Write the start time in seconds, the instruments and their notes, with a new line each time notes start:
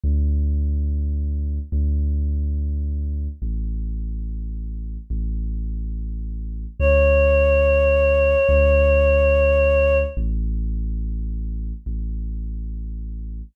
0.04 synth bass 2 D2
1.72 synth bass 2 D2
3.42 synth bass 2 A1
5.10 synth bass 2 A1
6.80 synth bass 2 D2, choir aahs C#5
8.49 synth bass 2 D2
10.17 synth bass 2 A1
11.86 synth bass 2 A1